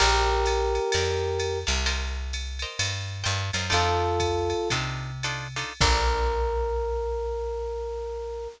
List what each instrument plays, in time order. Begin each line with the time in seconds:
0.00 electric bass (finger) A#1, electric piano 1 G4 A#4, acoustic guitar (steel) A#4 D5 F5 A5, crash, ride
0.46 hi-hat pedal, ride
0.75 ride
0.92 electric bass (finger) F2, acoustic guitar (steel) A#4 D5 F5 A5, ride
1.40 hi-hat pedal, ride
1.67 electric bass (finger) C2, acoustic guitar (steel) A#4 D5 F5 A5, snare, ride
1.86 acoustic guitar (steel) A#4 C5 D#5 G5, ride
2.33 hi-hat pedal, ride
2.59 acoustic guitar (steel) A#4 C5 D#5 G5, ride
2.79 electric bass (finger) G2, ride
3.24 electric bass (finger) G2, acoustic guitar (steel) A#4 C5 D#5 G5, hi-hat pedal, ride
3.53 electric bass (finger) F#2, acoustic guitar (steel) A#4 C5 D#5 G5, snare, ride
3.70 electric bass (finger) F2, acoustic guitar (steel) D4 D#4 F4 A4, electric piano 1 F4 A4, ride
4.20 kick, hi-hat pedal, ride
4.50 ride
4.70 electric bass (finger) C3, acoustic guitar (steel) D4 D#4 F4 A4, kick, ride
5.23 acoustic guitar (steel) D4 D#4 F4 A4, hi-hat pedal, ride
5.56 acoustic guitar (steel) D4 D#4 F4 A4, snare, ride
5.81 electric bass (finger) A#1, acoustic guitar (steel) A#3 D4 F4 A4, electric piano 1 A#4, kick, crash